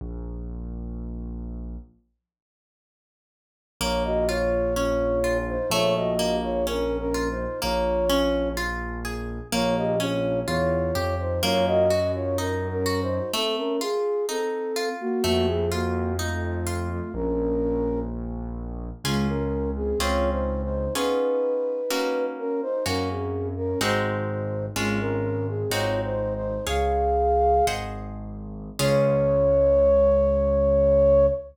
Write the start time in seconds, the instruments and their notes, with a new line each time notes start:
0.01 acoustic grand piano A#1
3.81 acoustic grand piano A#1, orchestral harp A#3, flute F4 C#5
4.04 flute F#4 D#5
4.28 flute F4 C#5, orchestral harp F4
4.76 orchestral harp C#4, flute F4 C#5
5.24 orchestral harp F4
5.48 flute D#4 C5
5.70 acoustic grand piano A#1, orchestral harp A3, flute F4 C#5
5.96 flute F#4 D#5
6.19 orchestral harp A#3
6.43 flute F4 C#5
6.66 flute C#4 A#4, orchestral harp C#4
6.98 flute C#4 A#4
7.14 orchestral harp F4
7.30 flute D#4 C5
7.62 acoustic grand piano A#1, orchestral harp A#3, flute F4 C#5
8.10 orchestral harp C#4
8.57 orchestral harp F4
9.05 orchestral harp G#4
9.52 acoustic grand piano A#1, orchestral harp A#3, flute F4 C#5
9.77 flute G4 D#5
10.00 orchestral harp C#4, flute F4 C#5
10.47 acoustic grand piano E2, flute F4 C#5, orchestral harp F4
10.95 acoustic grand piano F2, orchestral harp G4
11.19 flute D#4 C5
11.43 acoustic grand piano F#2, orchestral harp A#3, flute F4 C#5
11.66 flute F#4 D#5
11.90 orchestral harp F#4
12.15 flute F4 C#5
12.38 flute C#4 A#4, orchestral harp D#4
12.70 flute C#4 A#4
12.86 orchestral harp F#4
13.02 flute D#4 C5
13.33 orchestral harp A3, flute C4 A4
13.57 flute C#4 A#4
13.81 orchestral harp F4, flute G#4
14.29 flute C4 A4, orchestral harp D#4
14.76 orchestral harp F4
15.00 flute A#3 F#4
15.23 acoustic grand piano F2, orchestral harp A3, flute A#3 F#4
15.47 flute G#4
15.72 flute A#3 F#4, orchestral harp F4
16.19 flute A3 F4, orchestral harp D#4
16.67 orchestral harp F4
16.90 flute A3 F4
17.14 acoustic grand piano A#1, flute C#4 A#4
19.04 acoustic grand piano C#2, flute G#3 F4, orchestral harp C#4 F4 G#4
19.29 flute C#4 A#4
19.76 flute C4 G#4
19.99 acoustic grand piano C#2, orchestral harp C4 C#4 F4 G#4, flute F4 C#5
20.32 flute D#4 C5
20.63 flute D#4 C5
20.95 orchestral harp B3 C#4 F4 G#4, flute D#4 B4
21.90 orchestral harp A#3 C#4 F#4
22.38 flute C#4 A#4
22.62 flute D#4 C5
22.86 acoustic grand piano F#2, orchestral harp A#3 C#4 F#4, flute C#4 A#4
23.10 flute C4 G#4
23.57 flute C#4 A#4
23.81 acoustic grand piano G#1, orchestral harp G#3 C4 D#4 F#4, flute D#4 C5
24.76 acoustic grand piano G#1, orchestral harp G#3 C#4 F4, flute G#3 F4
25.00 flute C#4 A#4
25.48 flute C4 G#4
25.70 acoustic grand piano G#1, orchestral harp G#3 C4 D#4 F#4, flute F4 C#5
26.04 flute D#4 C5
26.35 flute D#4 C5
26.67 acoustic grand piano C#2, orchestral harp G#4 C#5 F5, flute G#4 F5
27.67 acoustic grand piano G#1, orchestral harp G#4 C5 D#5 F#5
28.79 acoustic grand piano C#2, orchestral harp C#4 F4 G#4, flute C#5